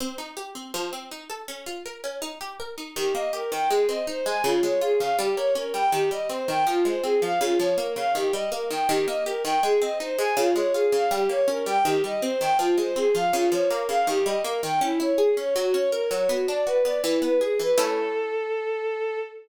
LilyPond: <<
  \new Staff \with { instrumentName = "Violin" } { \time 2/2 \key aes \major \tempo 2 = 81 r1 | r1 | g'8 ees''8 bes'8 g''8 aes'8 ees''8 c''8 aes''8 | f'8 des''8 aes'8 f''8 g'8 des''8 bes'8 g''8 |
g'8 ees''8 c''8 g''8 f'8 c''8 aes'8 f''8 | f'8 des''8 bes'8 f''8 g'8 ees''8 bes'8 g''8 | g'8 ees''8 bes'8 g''8 aes'8 ees''8 c''8 aes''8 | f'8 des''8 aes'8 f''8 g'8 des''8 bes'8 g''8 |
g'8 ees''8 c''8 g''8 f'8 c''8 aes'8 f''8 | f'8 des''8 bes'8 f''8 g'8 ees''8 bes'8 g''8 | \key a \major e'8 cis''8 gis'8 cis''8 fis'8 cis''8 ais'8 cis''8 | fis'8 d''8 b'8 d''8 e'8 b'8 gis'8 b'8 |
a'1 | }
  \new Staff \with { instrumentName = "Harpsichord" } { \time 2/2 \key aes \major c'8 ees'8 g'8 c'8 f8 c'8 ees'8 a'8 | des'8 f'8 bes'8 des'8 ees'8 g'8 bes'8 ees'8 | ees8 bes8 g'8 ees8 aes8 c'8 ees'8 aes8 | des8 aes8 f'8 des8 g8 bes8 des'8 g8 |
ees8 g8 c'8 ees8 f8 aes8 c'8 f8 | des8 f8 bes8 des8 ees8 g8 bes8 ees8 | ees8 bes8 g'8 ees8 aes8 c'8 ees'8 aes8 | des8 aes8 f'8 des8 g8 bes8 des'8 g8 |
ees8 g8 c'8 ees8 f8 aes8 c'8 f8 | des8 f8 bes8 des8 ees8 g8 bes8 ees8 | \key a \major cis'8 e'8 gis'8 cis'8 fis8 cis'8 ais'8 fis8 | b8 d'8 fis'8 b8 e8 b8 gis'8 e8 |
<a cis' e'>1 | }
>>